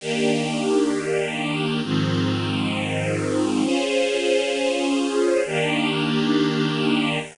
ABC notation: X:1
M:9/8
L:1/8
Q:3/8=99
K:Ebmix
V:1 name="String Ensemble 1"
[E,B,=DG]9 | [A,,E,F,C]9 | [DFAc]9 | [E,B,=DG]9 |]